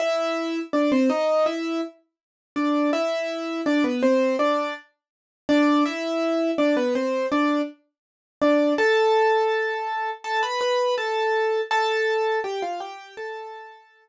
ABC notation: X:1
M:4/4
L:1/16
Q:1/4=82
K:Am
V:1 name="Acoustic Grand Piano"
[Ee]4 [Dd] [Cc] [^D^d]2 [Ee]2 z4 [=D=d]2 | [Ee]4 [Dd] [B,B] [Cc]2 [Dd]2 z4 [Dd]2 | [Ee]4 [Dd] [B,B] [Cc]2 [Dd]2 z4 [Dd]2 | [Aa]8 [Aa] [Bb] [Bb]2 [Aa]4 |
[Aa]4 [Gg] [Ff] [Gg]2 [Aa]6 z2 |]